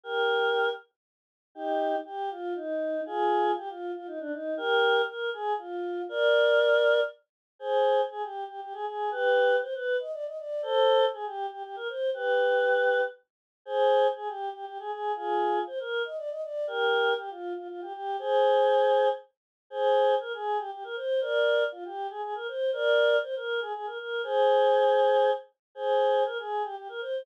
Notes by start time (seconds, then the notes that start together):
0.03 G4 A#4
1.55 D#4 G4
2.05 G4
2.31 F4
2.55 D#4
3.06 F4 G#4
3.57 G4
3.69 F4
3.95 F4
4.07 D#4
4.20 D4
4.33 D#4
4.57 G4 A#4
5.08 A#4
5.33 G#4
5.58 F4
6.09 A#4 D5
7.59 G#4 C5
8.10 G#4
8.23 G4
8.48 G4
8.61 G4
8.73 G#4
8.86 G#4
9.11 G4 B4
9.62 C5
9.74 B4
10.00 D#5
10.12 D5
10.25 D#5
10.37 D5
10.62 A4 C5
11.13 G#4
11.26 G4
11.51 G4
11.64 G4
11.76 A#4
11.89 C5
12.14 G4 B4
13.65 G#4 C5
14.16 G#4
14.28 G4
14.53 G4
14.66 G4
14.79 G#4
14.91 G#4
15.16 F4 G#4
15.67 C5
15.80 A#4
16.05 D#5
16.17 D5
16.30 D#5
16.42 D5
16.67 G4 A#4
17.18 G4
17.30 F4
17.56 F4
17.69 F4
17.81 G4
17.93 G4
18.19 G#4 C5
19.70 G#4 C5
20.20 A#4
20.33 G#4
20.58 G4
20.72 G4
20.84 A#4
20.96 C5
21.21 A#4 D5
21.72 F4
21.85 G4
22.10 G#4
22.22 G#4
22.35 A#4
22.48 C5
22.73 A#4 D5
23.23 C5
23.36 A#4
23.60 G#4
23.74 G#4
23.86 A#4
23.99 A#4
24.23 G#4 C5
25.75 G#4 C5
26.26 A#4
26.38 G#4
26.63 G4
26.76 G4
26.89 A#4
27.01 C5